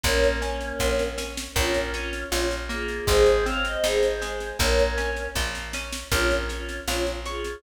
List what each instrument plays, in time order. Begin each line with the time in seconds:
0.03 electric bass (finger) A#1, choir aahs A#3 C#4, orchestral harp A#3, kick, snare
0.24 snare
0.41 choir aahs A#3 C#4, orchestral harp C#4, snare
0.61 snare
0.79 electric bass (finger) A#1, orchestral harp F4, kick, snare
0.99 snare
1.18 orchestral harp C#4, snare
1.37 snare
1.55 electric bass (finger) A#1, orchestral harp A#3, choir aahs C#4 F4, kick, snare
1.74 snare
1.93 choir aahs C#4 F4, orchestral harp C#4, snare
2.13 snare
2.31 electric bass (finger) A#1, choir aahs C#4 F4, orchestral harp F4, snare
2.51 snare
2.69 orchestral harp A#3, choir aahs F4 G#4, snare
2.88 snare
3.07 electric bass (finger) G#1, orchestral harp G#3, choir aahs G#4 C5, kick, snare
3.26 snare
3.46 orchestral harp C4, choir aahs C#5 F5, snare
3.65 choir aahs C5 D#5, snare
3.84 electric bass (finger) G#1, orchestral harp D#4, choir aahs G#4 C5, snare
4.03 snare
4.22 orchestral harp G#3, snare
4.40 snare
4.59 electric bass (finger) A#1, orchestral harp A#3, choir aahs A#4 C#5, kick, snare
4.79 snare
4.97 orchestral harp C#4, snare
5.16 snare
5.35 electric bass (finger) A#1, orchestral harp F4, kick, snare
5.55 snare
5.73 orchestral harp C#4, snare
5.92 snare
6.11 electric bass (finger) A#1, choir aahs C#4 F4, orchestral harp A#4, kick, snare
6.31 snare
6.49 choir aahs C#4 F4, orchestral harp C#5, snare
6.69 snare
6.88 electric bass (finger) A#1, choir aahs C#4 F4, orchestral harp F5, snare
7.06 snare
7.25 choir aahs F4 G#4, orchestral harp C#5, snare
7.44 snare